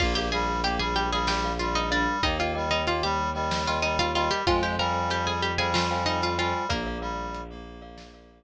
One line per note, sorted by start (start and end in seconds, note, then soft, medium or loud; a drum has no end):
0.00 2.06 A#1 medium
0.00 0.29 A#3 loud
0.00 0.15 F4 medium
0.00 0.12 A#4 loud
0.00 0.12 D5 medium
0.00 0.12 F5 loud
0.00 0.15 F5 medium
0.00 kick loud
0.00 crash loud
0.15 0.30 G4 medium
0.15 0.29 A#4 medium
0.15 0.29 D5 medium
0.15 0.29 F5 medium
0.15 0.30 G5 medium
0.32 0.60 G3 loud
0.32 0.62 G#4 medium
0.32 0.84 A#4 medium
0.32 0.84 D5 medium
0.32 0.84 F5 medium
0.32 0.62 G#5 medium
0.64 0.79 A#3 loud
0.64 0.79 G4 medium
0.64 0.79 G5 medium
0.64 closed hi-hat medium
0.79 1.09 G3 loud
0.79 0.95 G#4 medium
0.79 0.95 G#5 medium
0.96 1.11 G4 medium
0.96 1.11 G5 medium
1.12 1.51 G3 loud
1.12 1.28 G#4 medium
1.12 1.38 A#4 medium
1.12 1.38 D5 medium
1.12 1.38 F5 medium
1.12 1.28 G#5 medium
1.27 1.57 G4 medium
1.27 1.57 G5 medium
1.27 snare loud
1.44 1.83 A#4 medium
1.44 1.83 D5 loud
1.44 1.83 F5 medium
1.59 1.90 G3 medium
1.59 1.74 F4 medium
1.59 1.74 F5 medium
1.75 1.90 D#4 medium
1.75 1.90 D#5 medium
1.75 closed hi-hat medium
1.91 2.22 G3 loud
1.91 2.19 D4 medium
1.91 2.16 A#4 medium
1.91 2.16 D5 medium
1.91 2.19 D5 medium
1.91 2.16 F5 medium
2.23 4.28 D#2 medium
2.23 2.54 A#3 loud
2.23 2.38 D#4 medium
2.23 2.36 A#4 loud
2.23 2.36 D#5 loud
2.23 2.38 D#5 medium
2.23 2.36 G5 loud
2.23 kick medium
2.23 closed hi-hat medium
2.39 2.66 F4 medium
2.39 2.52 A#4 medium
2.39 2.52 D#5 loud
2.39 2.66 F5 medium
2.39 2.52 G5 medium
2.55 2.83 G3 medium
2.55 3.06 A#4 loud
2.55 3.06 D#5 medium
2.55 3.06 G5 medium
2.71 2.86 D#4 medium
2.71 2.86 D#5 medium
2.87 3.02 A#3 loud
2.87 3.03 F4 medium
2.87 3.03 F5 medium
2.87 closed hi-hat medium
3.03 3.30 G3 loud
3.03 3.56 G4 medium
3.03 3.56 G5 medium
3.34 3.78 G3 loud
3.34 3.61 A#4 medium
3.34 3.61 D#5 medium
3.34 3.61 G5 medium
3.51 snare loud
3.67 3.83 F4 medium
3.67 4.06 A#4 medium
3.67 4.06 D#5 medium
3.67 3.83 F5 medium
3.67 4.06 G5 medium
3.82 4.11 G3 medium
3.82 3.98 D#4 medium
3.82 3.98 D#5 medium
3.99 4.14 F4 medium
3.99 4.14 F5 medium
3.99 closed hi-hat medium
4.14 4.43 G3 loud
4.14 4.30 F4 medium
4.14 4.40 A#4 loud
4.14 4.40 D#5 loud
4.14 4.30 F5 medium
4.14 4.40 G5 medium
4.31 4.46 G4 medium
4.31 4.46 G5 medium
4.47 6.53 F2 medium
4.47 4.76 G#3 loud
4.47 4.62 F4 medium
4.47 4.60 C5 loud
4.47 4.62 F5 medium
4.47 4.60 F5 loud
4.47 4.60 G5 loud
4.47 4.60 G#5 loud
4.47 kick loud
4.47 closed hi-hat loud
4.63 4.78 G4 medium
4.63 4.76 C5 medium
4.63 4.76 F5 medium
4.63 4.76 G5 medium
4.63 4.78 G5 medium
4.63 4.76 G#5 medium
4.79 5.09 G3 loud
4.79 5.08 A#4 medium
4.79 5.30 C5 medium
4.79 5.30 F5 loud
4.79 5.30 G5 medium
4.79 5.30 G#5 medium
4.79 5.08 A#5 medium
5.10 5.26 G3 loud
5.10 5.26 G4 medium
5.10 5.26 G5 medium
5.10 closed hi-hat medium
5.27 5.52 G3 medium
5.27 5.42 G#4 medium
5.27 5.42 G#5 medium
5.42 5.58 G4 medium
5.42 5.58 G5 medium
5.58 6.04 G3 loud
5.58 5.73 G#4 medium
5.58 5.84 C5 medium
5.58 5.84 F5 medium
5.58 5.84 G5 medium
5.58 5.73 G#5 medium
5.58 5.84 G#5 medium
5.74 6.05 F4 medium
5.74 6.05 F5 medium
5.74 snare loud
5.91 6.29 C5 medium
5.91 6.29 F5 loud
5.91 6.29 G5 medium
5.91 6.29 G#5 medium
6.06 6.36 G3 loud
6.06 6.21 D#4 medium
6.06 6.21 D#5 medium
6.22 6.38 F4 medium
6.22 6.38 F5 medium
6.22 closed hi-hat medium
6.38 6.67 G3 loud
6.38 6.66 F4 medium
6.38 6.64 C5 medium
6.38 6.64 F5 medium
6.38 6.66 F5 medium
6.38 6.64 G5 medium
6.38 6.64 G#5 medium
6.69 8.44 A#1 medium
6.69 7.79 A#3 medium
6.69 6.98 A#3 loud
6.69 6.82 A#4 loud
6.69 7.79 A#4 medium
6.69 6.82 D5 loud
6.69 6.82 F5 loud
6.69 kick medium
6.69 closed hi-hat loud
6.86 6.99 A#4 medium
6.86 6.99 D5 medium
6.86 6.99 F5 medium
7.01 7.41 G3 loud
7.01 7.53 A#4 medium
7.01 7.53 D5 medium
7.01 7.53 F5 medium
7.34 closed hi-hat medium
7.50 8.40 A#3 loud
7.82 8.07 A#4 medium
7.82 8.07 D5 loud
7.82 8.07 F5 medium
7.98 snare medium
8.14 8.44 A#4 medium
8.14 8.44 D5 medium
8.14 8.44 F5 medium